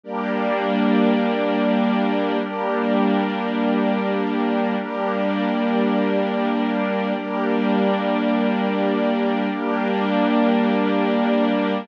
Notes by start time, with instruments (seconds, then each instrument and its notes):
0.03 pad 2 (warm) G3 A#3 D4, string ensemble 1 G4 A#4 D5
2.41 pad 2 (warm) G3 A#3 D4, string ensemble 1 G4 A#4 D5
4.77 pad 2 (warm) G3 A#3 D4, string ensemble 1 G4 A#4 D5
7.14 pad 2 (warm) G3 A#3 D4, string ensemble 1 G4 A#4 D5
9.50 pad 2 (warm) G3 A#3 D4, string ensemble 1 G4 A#4 D5